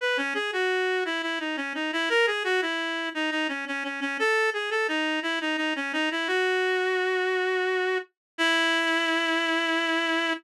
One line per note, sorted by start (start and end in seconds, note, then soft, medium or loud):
0.01 0.17 B4 medium
0.17 0.34 C#4 medium
0.34 0.51 G#4 medium
0.53 1.04 F#4 medium
1.05 1.22 E4 medium
1.22 1.39 E4 medium
1.40 1.56 D#4 medium
1.57 1.73 C#4 medium
1.75 1.91 D#4 medium
1.93 2.09 E4 medium
2.09 2.26 A#4 medium
2.27 2.43 G#4 medium
2.44 2.61 F#4 medium
2.62 3.09 E4 medium
3.15 3.30 D#4 medium
3.31 3.47 D#4 medium
3.48 3.65 C#4 medium
3.67 3.83 C#4 medium
3.84 4.00 C#4 medium
4.01 4.17 C#4 medium
4.19 4.50 A4 medium
4.53 4.70 G#4 medium
4.71 4.87 A4 medium
4.88 5.20 D#4 medium
5.23 5.39 E4 medium
5.41 5.57 D#4 medium
5.57 5.74 D#4 medium
5.76 5.92 C#4 medium
5.93 6.09 D#4 medium
6.11 6.28 E4 medium
6.27 7.98 F#4 medium
8.38 10.33 E4 loud